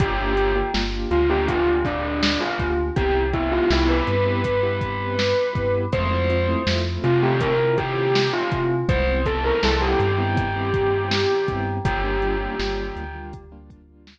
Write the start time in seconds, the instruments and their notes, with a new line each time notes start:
0.00 synth bass 2 G1, acoustic grand piano A#3 D4 F4 G4, tubular bells G4, kick, closed hi-hat
0.19 acoustic grand piano A#3 D4 F4 G4
0.37 acoustic grand piano A#3 D4 F4 G4, closed hi-hat
0.56 acoustic grand piano A#3 D4 F4 G4
0.74 synth bass 2 G1, acoustic grand piano A#3 D4 F4 G4, snare
1.11 synth bass 2 D2, tubular bells F4, closed hi-hat
1.29 acoustic grand piano A#3 D4 F4 G4, tubular bells G4
1.48 tubular bells F4, kick, closed hi-hat
1.67 acoustic grand piano A#3 D4 F4 G4
1.85 tubular bells D4, kick, snare, closed hi-hat
2.23 snare
2.41 tubular bells F4
2.59 synth bass 2 D2, acoustic grand piano A#3 D4 F4 G4, kick, closed hi-hat
2.96 synth bass 2 C2, acoustic grand piano B3 C4 E4 G4, tubular bells G4, kick, closed hi-hat
3.15 acoustic grand piano B3 C4 E4 G4
3.33 acoustic grand piano B3 C4 E4 G4, tubular bells E4, kick, closed hi-hat
3.52 acoustic grand piano B3 C4 E4 G4, tubular bells F4
3.70 synth bass 2 C2, acoustic grand piano B3 C4 E4 G4, tubular bells E4, snare
3.89 tubular bells B4
4.07 synth bass 2 G2, closed hi-hat
4.26 acoustic grand piano B3 C4 E4 G4
4.44 kick, closed hi-hat
4.63 acoustic grand piano B3 C4 E4 G4
4.81 kick, closed hi-hat
5.19 snare
5.55 synth bass 2 G2, acoustic grand piano B3 C4 E4 G4, kick, closed hi-hat
5.92 synth bass 2 F2, acoustic grand piano A3 C4 E4 F4, tubular bells C5, kick, closed hi-hat
6.11 acoustic grand piano A3 C4 E4 F4
6.29 acoustic grand piano A3 C4 E4 F4, closed hi-hat
6.48 acoustic grand piano A3 C4 E4 F4
6.67 synth bass 2 F2, acoustic grand piano A3 C4 E4 F4, snare
7.04 synth bass 2 C3, tubular bells F4, closed hi-hat
7.22 acoustic grand piano A3 C4 E4 F4, tubular bells G4
7.40 tubular bells A#4, kick, closed hi-hat
7.59 acoustic grand piano A3 C4 E4 F4
7.78 tubular bells G4, kick, closed hi-hat
8.15 snare
8.33 tubular bells F4
8.52 synth bass 2 C3, acoustic grand piano A3 C4 E4 F4, kick, closed hi-hat
8.88 synth bass 2 C2, acoustic grand piano G3 B3 C4 E4, tubular bells C5, kick, closed hi-hat
9.07 acoustic grand piano G3 B3 C4 E4
9.26 acoustic grand piano G3 B3 C4 E4, tubular bells A4, kick, closed hi-hat
9.44 acoustic grand piano G3 B3 C4 E4, tubular bells A#4
9.63 synth bass 2 C2, acoustic grand piano G3 B3 C4 E4, tubular bells A4, snare
9.81 tubular bells G4
10.00 synth bass 2 G2, closed hi-hat
10.18 acoustic grand piano G3 B3 C4 E4
10.37 kick, closed hi-hat
10.56 acoustic grand piano G3 B3 C4 E4
10.74 kick, closed hi-hat
11.11 snare
11.48 synth bass 2 G2, acoustic grand piano G3 B3 C4 E4, kick, closed hi-hat
11.85 synth bass 2 G1, acoustic grand piano G3 A#3 D4 F4, tubular bells G4, kick, closed hi-hat
12.04 acoustic grand piano G3 A#3 D4 F4
12.22 acoustic grand piano G3 A#3 D4 F4, closed hi-hat
12.41 acoustic grand piano G3 A#3 D4 F4
12.59 synth bass 2 G1, acoustic grand piano G3 A#3 D4 F4, snare
12.96 synth bass 2 D2, closed hi-hat
13.15 acoustic grand piano G3 A#3 D4 F4
13.33 kick, closed hi-hat
13.52 acoustic grand piano G3 A#3 D4 F4
13.70 kick, closed hi-hat
14.07 snare